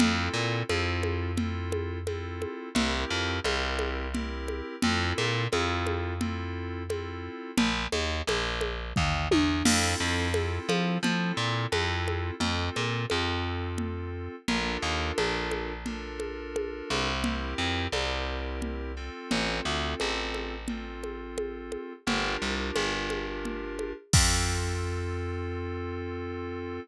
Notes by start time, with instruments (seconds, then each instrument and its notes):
0.00 electric bass (finger) F2, electric piano 2 C4 E4 F4 A4, low conga
0.34 electric bass (finger) A#2
0.69 electric bass (finger) F2, electric piano 2 C4 E4 F4 A4, high conga
1.03 high conga
1.37 electric piano 2 C4 E4 F4 A4, low conga
1.72 high conga
2.07 electric piano 2 C4 E4 F4 A4, high conga
2.42 high conga
2.75 electric bass (finger) C2, electric piano 2 C4 E4 G4 A#4, low conga
3.10 electric bass (finger) F2
3.44 electric bass (finger) C2, electric piano 2 C4 E4 G4 A#4, high conga
3.79 high conga
4.14 electric piano 2 C4 E4 G4 A#4, low conga
4.48 high conga
4.82 electric bass (finger) F2, electric piano 2 C4 E4 F4 A4, low conga
5.18 electric bass (finger) A#2, high conga
5.52 electric bass (finger) F2, electric piano 2 C4 E4 F4 A4, high conga
5.87 high conga
6.21 electric piano 2 C4 E4 F4 A4, low conga
6.89 electric piano 2 C4 E4 F4 A4, high conga
7.57 electric bass (finger) A#1, low conga
7.92 electric bass (finger) D#2, high conga
8.27 electric bass (finger) A#1, high conga
8.61 high conga
8.96 electric bass (finger) D#2, kick, floor tom
9.31 electric bass (finger) E2, high tom
9.65 electric bass (finger) F2, electric piano 2 C4 E4 F4 A4, crash, low conga
10.00 electric bass (finger) F2
10.34 electric piano 2 C4 E4 F4 A4, high conga
10.69 electric bass (finger) F3, high conga
11.03 electric bass (finger) F3, electric piano 2 C4 E4 F4 A4, low conga
11.37 electric bass (finger) A#2
11.72 electric bass (finger) F2, electric piano 2 C4 E4 F4 A4, high conga
12.08 high conga
12.40 electric bass (finger) F2, electric piano 2 C4 F4 A4, low conga
12.76 electric bass (finger) A#2, high conga
13.10 electric bass (finger) F2, electric piano 2 C4 F4 A4, high conga
13.78 low conga
14.48 electric bass (finger) A#1, electric piano 2 D4 F4 A4 A#4, low conga
14.82 electric bass (finger) D#2
15.18 electric bass (finger) A#1, high conga
15.51 high conga
15.86 electric piano 2 D4 F4 A4 A#4, low conga
16.20 high conga
16.56 high conga
16.90 electric bass (finger) C2, high conga
17.24 electric piano 2 C4 E4 G4 A#4, low conga
17.58 electric bass (finger) F2
17.92 electric bass (finger) C2, electric piano 2 C4 E4 G4 A#4, high conga
18.62 low conga
18.97 electric piano 2 C4 F4 A4
19.31 electric bass (finger) A1, low conga
19.65 electric bass (finger) D2
20.00 electric bass (finger) A1, high conga
20.34 high conga
20.68 electric piano 2 C4 F4 A4, low conga
21.04 high conga
21.38 high conga
21.72 high conga
22.07 electric bass (finger) G1, electric piano 2 D4 F4 G4 A#4, low conga
22.42 electric bass (finger) C2
22.76 electric bass (finger) G1, high conga
23.10 high conga
23.45 low conga
23.79 high conga
24.13 electric bass (finger) F2, electric piano 2 C4 F4 A4, kick, crash